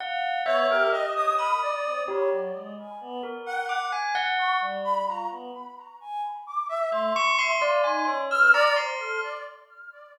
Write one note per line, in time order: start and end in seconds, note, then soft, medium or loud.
0.00 0.41 F5 loud
0.00 0.42 F#5 medium
0.45 0.66 B3 loud
0.45 0.67 C#5 medium
0.45 0.88 E5 loud
0.69 0.89 G4 loud
0.69 0.90 A#4 medium
0.92 1.33 G4 soft
0.92 1.13 D#5 medium
0.92 1.34 D#5 medium
1.16 1.36 D#6 loud
1.38 1.59 B5 medium
1.38 2.01 D#6 medium
1.62 2.03 D5 medium
1.85 2.06 C4 medium
2.07 2.29 G4 medium
2.07 2.28 C#5 loud
2.31 2.52 F#3 medium
2.54 2.75 G#3 medium
2.77 2.98 G#5 medium
3.01 3.22 B3 loud
3.23 3.65 A#4 soft
3.45 3.88 F#5 medium
3.45 3.66 G5 medium
3.69 3.90 D6 medium
3.92 4.13 G#5 medium
4.15 4.57 F#5 loud
4.39 4.59 C#6 medium
4.61 5.02 G3 medium
4.84 5.05 B5 medium
5.07 5.28 F4 medium
5.07 5.28 A#5 medium
5.30 5.51 B3 medium
6.01 6.21 G#5 loud
6.47 6.67 D6 medium
6.69 6.90 E5 medium
6.91 7.12 A3 medium
6.91 7.13 E5 medium
6.91 8.17 C6 medium
7.16 7.37 C#6 loud
7.38 7.58 E5 medium
7.38 7.59 C6 loud
7.61 7.82 D5 medium
7.61 7.82 F5 medium
7.84 8.05 D#4 medium
7.84 8.05 G#5 medium
8.07 8.29 C#4 medium
8.07 8.28 C#5 medium
8.30 8.51 B4 medium
8.30 8.52 E6 medium
8.30 8.52 F6 loud
8.53 8.74 D5 loud
8.53 8.75 A#5 loud
8.76 8.97 C5 medium
8.76 9.18 C6 medium
8.99 9.20 A4 medium